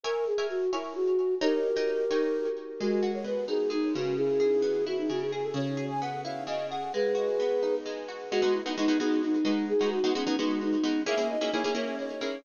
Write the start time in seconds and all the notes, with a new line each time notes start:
0.04 A#4 C#5 E5 G#5
0.27 G#4
0.38 A#4 C#5 E5 G#5
0.50 F#4
0.72 E4 A#4 C#5 E5 G#5
0.95 F#4
1.41 D#4 G4 A#4 C#5 G5 A#5
1.77 D#4 C#5 G5 A#5
2.11 D#4 C#5 G5 A#5
2.79 G#3 F#4
3.03 F#4
3.14 C#5
3.24 B3 B4
3.48 D#4 G#4
3.70 G#3 D#4
3.94 C#3 F#4
4.17 E4 G#4
4.40 G#4
4.62 B3
4.86 E4 F#4
4.98 D#4
5.09 C#3 F#4
5.21 G#4
5.32 G#4
5.44 A4
5.54 C#3 C#5
5.77 G#4
5.90 G#5
6.01 B3 F#5
6.24 E4 F5
6.47 C#3 D#5
6.70 G#4 F#5
6.93 G#3 G#4 B4
7.15 F#4
7.40 B3
7.63 D#4
7.86 G#3
8.08 F#4
8.31 G#3 B3 D#4 F#4
8.42 G#3 B3 D#4 F#4
8.54 E4
8.66 G#3 B3 D#4 F#4
8.77 G#3 B3 D#4 F#4
8.88 G#3 B3 D#4 F#4
9.00 G#3 B3 D#4 F#4
9.23 D#4
9.45 G#3 B3 D#4 F#4
9.69 G#4
9.81 G#3 B3 D#4 F#4
9.92 F#4
10.04 G#3 B3 D#4 F#4
10.15 G#3 B3 C#4 D#4 F#4
10.27 G#3 B3 D#4 F#4
10.39 G#3 B3 D#4 F#4
10.61 D#4
10.84 G#3 B3 D#4 F#4
11.06 A#3 C#4 E4 G#4 E5
11.17 A#3 C#4 E4 G#4
11.30 D#5
11.41 A#3 C#4 E4 G#4
11.53 A#3 C#4 E4 G#4 C#5
11.64 A#3 C#4 E4 G#4
11.75 A#3 C#4 E4 G#4 C#5
11.99 C#5
12.21 A#3 C#4 E4 G#4